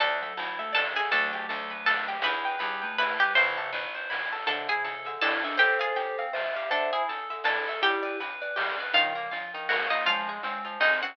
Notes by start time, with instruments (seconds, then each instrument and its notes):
0.00 electric bass (finger) D2, vibraphone E3, electric piano 2 D4, pizzicato strings A4 D5 A5, kick, closed hi-hat
0.22 vibraphone F#3, electric piano 2 A4, pizzicato strings E5, closed hi-hat
0.37 electric bass (finger) D2, electric piano 2 E4, pizzicato strings A5, closed hi-hat
0.59 vibraphone A3, electric piano 2 A4, pizzicato strings E5, closed hi-hat
0.73 vibraphone E3, electric piano 2 D4, pizzicato strings A4 D5 A5, snare
0.95 pizzicato strings G#4 E5 G#5, electric piano 2 A4, closed hi-hat
1.11 electric bass (finger) D2, vibraphone F#3 A3, electric piano 2 D4, pizzicato strings A4 D5 A5, kick, closed hi-hat
1.32 electric piano 2 G4, pizzicato strings G5, closed hi-hat
1.49 electric bass (finger) D2, electric piano 2 A4, pizzicato strings A5, closed hi-hat
1.70 electric piano 2 B4, pizzicato strings B5, closed hi-hat
1.86 electric piano 2 D4, pizzicato strings A4 A5, snare
2.07 electric piano 2 G4, pizzicato strings G5, closed hi-hat
2.22 electric bass (finger) E2, electric piano 2 E4, pizzicato strings B4 E5 B5, kick, closed hi-hat
2.45 electric piano 2 B4, pizzicato strings G5, closed hi-hat
2.59 electric bass (finger) E2, vibraphone G3, electric piano 2 G4, pizzicato strings B5, closed hi-hat
2.82 vibraphone A3, electric piano 2 B4, pizzicato strings G5, closed hi-hat
2.98 electric piano 2 E4, pizzicato strings B4 E5 B5, snare
3.18 vibraphone G3, pizzicato strings G4 G5, electric piano 2 B4, closed hi-hat
3.35 electric bass (finger) A1, vibraphone C3 E3, electric piano 2 E4, pizzicato strings C5 E5 C6, kick, closed hi-hat
3.56 electric piano 2 A4, pizzicato strings A5, closed hi-hat
3.73 electric bass (finger) A1, electric piano 2 B4, pizzicato strings B5, closed hi-hat
3.94 electric piano 2 C5, pizzicato strings C6, closed hi-hat
4.10 electric piano 2 E4, pizzicato strings B5, snare
4.32 electric piano 2 A4, pizzicato strings A5, closed hi-hat
4.47 vibraphone C3 E3, electric piano 2 D3, pizzicato strings D4 A4 A5, kick, closed hi-hat
4.67 electric piano 2 E4, pizzicato strings G#4 E5 G#5, closed hi-hat
4.84 electric piano 2 A4, pizzicato strings A5, closed hi-hat
5.05 electric piano 2 D3, pizzicato strings E5, closed hi-hat
5.21 pizzicato strings D4 A4 A5, electric piano 2 E4, vibraphone E4, snare
5.43 vibraphone D4, electric piano 2 A4, pizzicato strings E5, closed hi-hat
5.57 electric piano 2 C4, pizzicato strings G4 C5 G5, vibraphone A4 C5, kick, closed hi-hat
5.79 electric piano 2 F4, pizzicato strings G#4 F5 G#5, closed hi-hat
5.96 electric piano 2 G4, pizzicato strings G5, closed hi-hat
6.18 electric piano 2 C4, pizzicato strings F5, closed hi-hat
6.33 electric piano 2 F4, pizzicato strings C5, vibraphone E5, snare
6.55 electric piano 2 G4, vibraphone E5, pizzicato strings F5, closed hi-hat
6.70 electric piano 2 D3, pizzicato strings D4 A4 A5, vibraphone C5 E5, kick
6.92 electric piano 2 E4, pizzicato strings G#4 E5 G#5, closed hi-hat
7.08 electric piano 2 A4, pizzicato strings A5, closed hi-hat
7.30 electric piano 2 D3, pizzicato strings E5, closed hi-hat
7.44 pizzicato strings D4 A4 A5, electric piano 2 E4, vibraphone A4, snare
7.65 electric piano 2 A4, pizzicato strings E5, closed hi-hat
7.82 electric piano 2 G3, vibraphone E4 G4, pizzicato strings G4 G5, kick, closed hi-hat
8.03 electric piano 2 B4, pizzicato strings D5, closed hi-hat
8.20 electric piano 2 B4, pizzicato strings B5, closed hi-hat
8.41 electric piano 2 B4, pizzicato strings D5, closed hi-hat
8.56 electric piano 2 G3, pizzicato strings G4, snare
8.78 electric piano 2 B4, pizzicato strings D5, closed hi-hat
8.93 vibraphone C#3 F3, electric piano 2 D#3, pizzicato strings D#4 F4 F5, kick, closed hi-hat
9.15 electric piano 2 A#3, pizzicato strings A#4, closed hi-hat
9.31 vibraphone F3, electric piano 2 F4, pizzicato strings F5, closed hi-hat
9.53 electric piano 2 D#3, pizzicato strings D#4, closed hi-hat
9.69 electric piano 2 A#3, vibraphone A#3, pizzicato strings F#4 A#4 F#5, snare
9.90 vibraphone A#3, pizzicato strings D#4 D#5 F5, electric piano 2 F4, closed hi-hat
10.06 vibraphone F3 G#3, electric piano 2 F3, pizzicato strings F4 F5, kick, closed hi-hat
10.27 electric piano 2 G#3, pizzicato strings G#4, closed hi-hat
10.43 vibraphone G#3, electric piano 2 C4, pizzicato strings C5, closed hi-hat
10.65 electric piano 2 F3, pizzicato strings F4, closed hi-hat
10.80 electric piano 2 G#3, vibraphone C4, pizzicato strings D#4 G#4 D#5, snare
11.01 electric piano 2 C4, vibraphone C#4, pizzicato strings F#4 C5 F#5, closed hi-hat